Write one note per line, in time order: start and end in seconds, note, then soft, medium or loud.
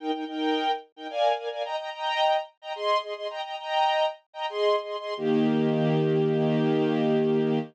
0.00 0.11 D#4 medium
0.00 0.11 A#4 medium
0.00 0.11 G5 medium
0.14 0.25 D#4 medium
0.14 0.25 A#4 medium
0.14 0.25 G5 medium
0.27 0.71 D#4 medium
0.27 0.71 A#4 medium
0.27 0.71 G5 medium
0.96 1.07 D#4 medium
0.96 1.07 A#4 medium
0.96 1.07 G5 medium
1.10 1.32 A#4 medium
1.10 1.32 D5 medium
1.10 1.32 F5 medium
1.10 1.32 G#5 medium
1.38 1.49 A#4 medium
1.38 1.49 D5 medium
1.38 1.49 F5 medium
1.38 1.49 G#5 medium
1.52 1.63 A#4 medium
1.52 1.63 D5 medium
1.52 1.63 F5 medium
1.52 1.63 G#5 medium
1.65 1.76 D#5 medium
1.65 1.76 G5 medium
1.65 1.76 A#5 medium
1.79 1.90 D#5 medium
1.79 1.90 G5 medium
1.79 1.90 A#5 medium
1.93 2.37 D#5 medium
1.93 2.37 G5 medium
1.93 2.37 A#5 medium
2.62 2.73 D#5 medium
2.62 2.73 G5 medium
2.62 2.73 A#5 medium
2.76 2.98 G#4 medium
2.76 2.98 D#5 medium
2.76 2.98 C6 medium
3.03 3.14 G#4 medium
3.03 3.14 D#5 medium
3.03 3.14 C6 medium
3.16 3.27 G#4 medium
3.16 3.27 D#5 medium
3.16 3.27 C6 medium
3.30 3.41 D#5 medium
3.30 3.41 G5 medium
3.30 3.41 A#5 medium
3.44 3.56 D#5 medium
3.44 3.56 G5 medium
3.44 3.56 A#5 medium
3.59 4.06 D#5 medium
3.59 4.06 G5 medium
3.59 4.06 A#5 medium
4.33 4.46 D#5 medium
4.33 4.46 G5 medium
4.33 4.46 A#5 medium
4.50 4.76 G#4 medium
4.50 4.76 D#5 medium
4.50 4.76 C6 medium
4.83 4.96 G#4 medium
4.83 4.96 D#5 medium
4.83 4.96 C6 medium
5.00 5.14 G#4 medium
5.00 5.14 D#5 medium
5.00 5.14 C6 medium
5.17 7.59 D#3 medium
5.17 7.59 A#3 medium
5.17 7.59 G4 loud